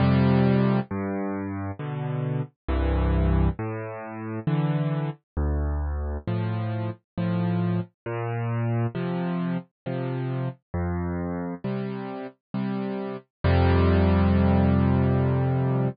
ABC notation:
X:1
M:3/4
L:1/8
Q:1/4=67
K:F
V:1 name="Acoustic Grand Piano" clef=bass
[F,,C,G,]2 G,,2 [=B,,D,]2 | [C,,G,,E,]2 A,,2 [D,E,]2 | D,,2 [A,,F,]2 [A,,F,]2 | B,,2 [C,F,]2 [C,F,]2 |
F,,2 [C,G,]2 [C,G,]2 | [F,,C,G,]6 |]